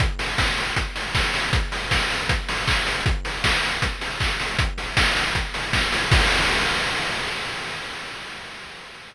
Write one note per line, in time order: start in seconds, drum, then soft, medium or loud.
0.00 kick medium
0.00 closed hi-hat medium
0.19 open hi-hat medium
0.38 kick medium
0.38 snare medium
0.57 open hi-hat medium
0.76 kick medium
0.76 closed hi-hat medium
0.96 open hi-hat medium
1.15 kick medium
1.15 snare medium
1.34 open hi-hat medium
1.53 kick medium
1.53 closed hi-hat medium
1.72 open hi-hat medium
1.91 kick medium
1.91 snare medium
2.10 open hi-hat medium
2.29 kick medium
2.29 closed hi-hat loud
2.48 open hi-hat medium
2.68 kick medium
2.68 clap loud
2.87 open hi-hat medium
3.06 kick medium
3.06 closed hi-hat medium
3.25 open hi-hat medium
3.44 kick medium
3.44 snare loud
3.63 open hi-hat medium
3.82 kick medium
3.82 closed hi-hat medium
4.01 open hi-hat medium
4.20 kick medium
4.20 clap medium
4.39 open hi-hat medium
4.59 kick medium
4.59 closed hi-hat loud
4.78 open hi-hat medium
4.97 kick medium
4.97 snare loud
5.16 open hi-hat medium
5.35 kick medium
5.35 closed hi-hat medium
5.54 open hi-hat medium
5.73 kick medium
5.73 snare medium
5.92 open hi-hat medium
6.12 kick loud
6.12 crash loud